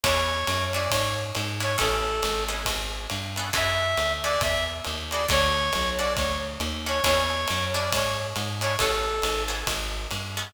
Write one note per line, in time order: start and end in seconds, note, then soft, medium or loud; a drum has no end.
0.03 0.44 E2 loud
0.03 0.37 C#4 loud
0.03 0.37 D4 loud
0.03 0.37 E4 loud
0.03 0.37 G#4 loud
0.03 0.64 C#5 medium
0.03 kick medium
0.03 ride medium
0.47 0.88 F#2 medium
0.47 hi-hat pedal medium
0.47 ride medium
0.73 1.02 C#4 loud
0.73 1.02 D4 medium
0.73 1.02 E4 medium
0.73 1.02 G#4 medium
0.73 0.90 D5 medium
0.73 ride medium
0.90 1.32 G#2 medium
0.90 1.14 C#5 medium
0.90 kick soft
0.90 ride loud
1.35 1.77 G#2 medium
1.35 hi-hat pedal medium
1.35 ride medium
1.60 1.73 C#4 medium
1.60 1.73 D4 loud
1.60 1.73 E4 medium
1.60 1.73 G#4 medium
1.60 1.77 C#5 medium
1.60 ride medium
1.78 2.21 A1 medium
1.78 2.11 B3 loud
1.78 2.11 C#4 loud
1.78 2.11 G#4 loud
1.78 2.11 A4 loud
1.78 2.43 A4 medium
1.78 kick soft
1.78 ride medium
2.22 2.64 G#1 medium
2.22 hi-hat pedal medium
2.22 ride medium
2.48 2.77 B3 medium
2.48 2.77 C#4 medium
2.48 2.77 G#4 medium
2.48 2.77 A4 loud
2.48 ride medium
2.65 3.07 G#1 medium
2.65 kick soft
2.65 ride medium
3.10 3.51 G2 medium
3.10 hi-hat pedal medium
3.10 ride medium
3.36 3.50 B3 loud
3.36 3.50 C#4 medium
3.36 3.50 G#4 medium
3.36 3.50 A4 loud
3.36 ride medium
3.53 3.95 F#2 medium
3.53 3.86 E4 loud
3.53 3.86 F#4 loud
3.53 3.86 G#4 loud
3.53 3.86 A4 medium
3.53 4.12 E5 medium
3.53 kick medium
3.53 ride medium
3.97 4.38 D2 medium
3.97 hi-hat pedal medium
3.97 ride medium
4.23 4.52 E4 medium
4.23 4.52 F#4 medium
4.23 4.52 G#4 medium
4.23 4.52 A4 medium
4.23 4.41 D5 medium
4.23 ride medium
4.41 4.81 E2 medium
4.41 4.64 E5 medium
4.41 kick medium
4.41 ride medium
4.84 5.27 D#2 medium
4.84 hi-hat pedal medium
4.84 ride medium
5.11 5.25 E4 medium
5.11 5.25 F#4 loud
5.11 5.25 G#4 loud
5.11 5.25 A4 medium
5.11 5.26 D5 medium
5.11 ride medium
5.28 5.71 D2 loud
5.28 5.62 C#4 loud
5.28 5.62 D4 loud
5.28 5.62 F#4 loud
5.28 5.62 A4 loud
5.28 5.89 C#5 loud
5.28 kick medium
5.28 ride medium
5.73 6.16 B1 medium
5.73 hi-hat pedal medium
5.73 ride medium
5.98 6.27 C#4 medium
5.98 6.27 D4 medium
5.98 6.27 F#4 medium
5.98 6.27 A4 loud
5.98 6.13 D5 medium
5.98 ride medium
6.16 6.58 D2 medium
6.16 6.38 C#5 medium
6.16 kick soft
6.16 ride medium
6.60 7.00 D#2 medium
6.60 hi-hat pedal medium
6.60 ride medium
6.86 6.99 C#4 medium
6.86 6.99 D4 medium
6.86 6.99 F#4 medium
6.86 6.99 A4 medium
6.86 7.03 C#5 medium
6.86 ride medium
7.04 7.46 E2 loud
7.04 7.37 C#4 loud
7.04 7.37 D4 loud
7.04 7.37 E4 loud
7.04 7.37 G#4 loud
7.04 7.64 C#5 medium
7.04 kick medium
7.04 ride medium
7.47 7.91 F#2 medium
7.47 hi-hat pedal medium
7.47 ride medium
7.74 8.03 C#4 loud
7.74 8.03 D4 medium
7.74 8.03 E4 medium
7.74 8.03 G#4 medium
7.74 7.90 D5 medium
7.74 ride medium
7.92 8.33 G#2 medium
7.92 8.17 C#5 medium
7.92 kick soft
7.92 ride loud
8.36 8.77 G#2 medium
8.36 hi-hat pedal medium
8.36 ride medium
8.61 8.74 C#4 medium
8.61 8.74 D4 loud
8.61 8.74 E4 medium
8.61 8.74 G#4 medium
8.61 8.76 C#5 medium
8.61 ride medium
8.78 9.21 A1 medium
8.78 9.13 B3 loud
8.78 9.13 C#4 loud
8.78 9.13 G#4 loud
8.78 9.43 A4 medium
8.78 9.13 A4 loud
8.78 kick soft
8.78 ride medium
9.22 9.64 G#1 medium
9.22 hi-hat pedal medium
9.22 ride medium
9.48 9.76 B3 medium
9.48 9.76 C#4 medium
9.48 9.76 G#4 medium
9.48 9.76 A4 loud
9.48 ride medium
9.67 10.07 G#1 medium
9.67 kick soft
9.67 ride medium
10.11 10.52 G2 medium
10.11 hi-hat pedal medium
10.11 ride medium
10.37 10.50 B3 loud
10.37 10.50 C#4 medium
10.37 10.50 G#4 medium
10.37 10.50 A4 loud
10.37 ride medium